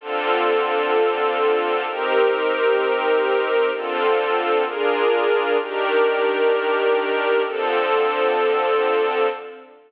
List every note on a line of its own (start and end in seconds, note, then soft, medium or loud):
0.01 1.85 D3 medium
0.01 1.85 C4 medium
0.01 1.85 F4 medium
0.01 1.85 A4 medium
1.86 3.70 C4 medium
1.86 3.70 D#4 medium
1.86 3.70 G4 medium
1.86 3.70 A#4 medium
3.72 4.64 D3 medium
3.72 4.64 C4 medium
3.72 4.64 F4 medium
3.72 4.64 A4 medium
4.65 5.57 D4 medium
4.65 5.57 F4 medium
4.65 5.57 G#4 medium
4.65 5.57 A#4 medium
5.58 7.42 D#3 medium
5.58 7.42 D4 medium
5.58 7.42 G4 medium
5.58 7.42 A#4 medium
7.44 9.28 D3 medium
7.44 9.28 F3 medium
7.44 9.28 C4 medium
7.44 9.28 A4 medium